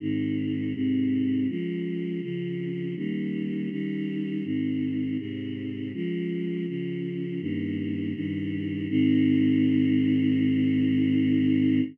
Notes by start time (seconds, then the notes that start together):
0.00 G#2 D#3 C4
0.74 G#2 C3 C4
1.48 F3 G#3 C#4
2.21 C#3 F3 C#4
2.96 D#3 G3 A#3 C#4
3.71 D#3 G3 C#4 D#4
4.44 G#2 D#3 C4
5.19 G#2 C3 C4
5.94 F3 G#3 C#4
6.67 C#3 F3 C#4
7.40 G2 D#3 A#3 C#4
8.15 G2 D#3 G3 C#4
8.89 G#2 D#3 C4